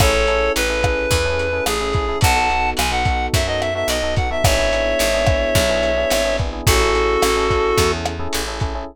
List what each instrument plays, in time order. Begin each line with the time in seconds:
0.00 electric bass (finger) A1, electric piano 1 C#4 E4 G#4 A4, clarinet A4 C#5, kick, cross-stick, closed hi-hat
0.14 electric piano 1 C#4 E4 G#4 A4
0.27 electric piano 1 C#4 E4 G#4 A4, closed hi-hat
0.56 electric bass (finger) A1, clarinet B4, closed hi-hat
0.69 electric piano 1 C#4 E4 G#4 A4
0.83 electric piano 1 C#4 E4 G#4 A4, kick, cross-stick, closed hi-hat
1.11 electric bass (finger) E2, kick, closed hi-hat
1.25 electric piano 1 C#4 E4 G#4 A4
1.39 closed hi-hat
1.53 electric piano 1 C#4 E4 G#4 A4
1.66 electric bass (finger) A1, clarinet G#4, cross-stick, closed hi-hat
1.81 electric piano 1 C#4 E4 G#4 A4
1.93 electric piano 1 C#4 E4 G#4 A4, kick, closed hi-hat
2.08 electric piano 1 C#4 E4 G#4 A4
2.21 electric bass (finger) B1, electric piano 1 B3 D#4 F#4 A4, clarinet F#5 A5, kick, closed hi-hat
2.36 electric piano 1 B3 D#4 F#4 A4
2.50 electric piano 1 B3 D#4 F#4 A4, closed hi-hat
2.77 electric bass (finger) B1, clarinet G#5, cross-stick, closed hi-hat
2.91 electric piano 1 B3 D#4 F#4 A4, clarinet F#5
3.05 electric piano 1 B3 D#4 F#4 A4, kick, closed hi-hat
3.33 electric bass (finger) F#2, clarinet E5, kick, closed hi-hat
3.47 electric piano 1 B3 D#4 F#4 A4, clarinet D#5
3.61 clarinet E5, cross-stick, closed hi-hat
3.75 electric piano 1 B3 D#4 F#4 A4, clarinet E5
3.88 electric bass (finger) B1, clarinet D#5, closed hi-hat
4.03 electric piano 1 B3 D#4 F#4 A4
4.16 electric piano 1 B3 D#4 F#4 A4, clarinet F#5, kick, closed hi-hat
4.31 electric piano 1 B3 D#4 F#4 A4, clarinet E5
4.44 electric bass (finger) G#1, electric piano 1 B3 D4 E4 G#4, clarinet C#5 E5, kick, cross-stick, closed hi-hat
4.58 electric piano 1 B3 D4 E4 G#4
4.72 electric piano 1 B3 D4 E4 G#4, closed hi-hat
4.99 electric bass (finger) G#1, closed hi-hat
5.14 electric piano 1 B3 D4 E4 G#4
5.27 electric piano 1 B3 D4 E4 G#4, kick, cross-stick, closed hi-hat
5.55 electric bass (finger) B1, kick, closed hi-hat
5.69 electric piano 1 B3 D4 E4 G#4
5.83 closed hi-hat
5.97 electric piano 1 B3 D4 E4 G#4
6.10 electric bass (finger) G#1, cross-stick, closed hi-hat
6.25 electric piano 1 B3 D4 E4 G#4
6.38 electric piano 1 B3 D4 E4 G#4, kick, closed hi-hat
6.53 electric piano 1 B3 D4 E4 G#4
6.67 electric bass (finger) A1, electric piano 1 C#4 E4 G#4 A4, clarinet F#4 A4, kick, closed hi-hat
6.81 electric piano 1 C#4 E4 G#4 A4
6.95 electric piano 1 C#4 E4 G#4 A4, closed hi-hat
7.22 electric bass (finger) A1, cross-stick, closed hi-hat
7.36 electric piano 1 C#4 E4 G#4 A4
7.50 electric piano 1 C#4 E4 G#4 A4, kick, closed hi-hat
7.78 electric bass (finger) E2, kick, closed hi-hat
7.92 electric piano 1 C#4 E4 G#4 A4
8.05 cross-stick, closed hi-hat
8.19 electric piano 1 C#4 E4 G#4 A4
8.33 electric bass (finger) A1, closed hi-hat
8.47 electric piano 1 C#4 E4 G#4 A4
8.60 electric piano 1 C#4 E4 G#4 A4, kick, closed hi-hat
8.75 electric piano 1 C#4 E4 G#4 A4